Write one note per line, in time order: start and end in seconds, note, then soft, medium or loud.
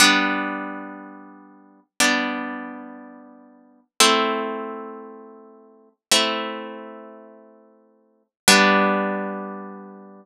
0.00 1.80 G3 medium
0.00 1.80 B3 medium
0.00 1.80 D4 medium
2.00 3.80 G3 medium
2.00 3.80 B3 medium
2.00 3.80 D4 medium
4.00 5.89 A3 medium
4.00 5.89 C4 medium
4.00 5.89 E4 medium
6.12 8.23 A3 medium
6.12 8.23 C4 medium
6.12 8.23 E4 medium
8.48 10.25 G3 loud
8.48 10.25 B3 loud
8.48 10.25 D4 loud